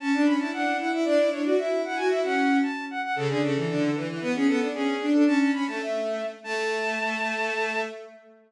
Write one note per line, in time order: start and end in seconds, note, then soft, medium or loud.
0.00 0.11 C#4 medium
0.00 0.22 A5 medium
0.13 0.24 D4 medium
0.25 0.38 C#4 medium
0.25 0.36 B5 medium
0.39 0.50 E4 medium
0.39 0.50 A5 medium
0.53 0.79 D4 medium
0.53 0.77 F#5 medium
0.79 0.90 E4 medium
0.79 0.91 F#5 medium
0.92 1.04 E4 loud
0.92 1.05 E5 medium
1.05 1.17 D4 loud
1.05 1.29 D5 loud
1.18 1.29 E4 medium
1.31 1.42 D4 medium
1.31 1.41 C#5 medium
1.44 1.57 F#4 medium
1.44 1.54 D5 medium
1.58 1.83 E4 medium
1.58 1.81 E5 medium
1.84 1.96 E4 medium
1.84 1.97 F#5 medium
1.96 2.10 F#4 medium
1.96 2.08 G#5 medium
2.10 2.22 E4 medium
2.10 2.21 E5 loud
2.24 2.58 C#4 medium
2.24 2.58 F#5 medium
2.63 2.85 A5 medium
2.91 3.01 F#5 medium
3.03 3.15 F#5 medium
3.16 3.27 C#3 medium
3.16 3.28 A4 loud
3.29 3.39 D3 medium
3.29 3.42 G#4 medium
3.42 3.54 C#3 medium
3.42 3.97 A4 medium
3.55 3.66 E3 medium
3.68 3.90 D3 medium
3.95 4.06 E3 medium
4.08 4.19 E3 medium
4.20 4.33 B3 loud
4.20 4.31 B4 medium
4.34 4.46 C#4 medium
4.34 4.47 G#4 medium
4.47 4.59 B3 loud
4.47 4.68 A4 medium
4.60 4.71 D4 medium
4.74 4.95 C#4 medium
4.74 5.06 G#4 medium
5.00 5.12 D4 medium
5.13 5.24 D4 medium
5.13 5.24 A4 medium
5.26 5.49 C#4 medium
5.26 5.38 A5 loud
5.39 5.51 A5 medium
5.53 5.65 C#4 medium
5.53 5.66 B5 medium
5.67 6.24 A3 medium
5.67 5.81 A5 medium
5.82 6.26 E5 medium
6.44 7.81 A3 loud
6.44 7.80 A5 loud